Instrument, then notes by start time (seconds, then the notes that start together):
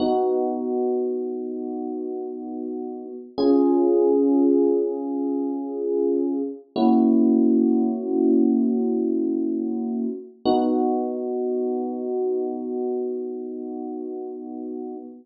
electric piano 1
0.00 B3 D#4 F#4
3.38 C#4 F4 G#4
6.76 A#3 C#4 E4 F#4
10.45 B3 D#4 F#4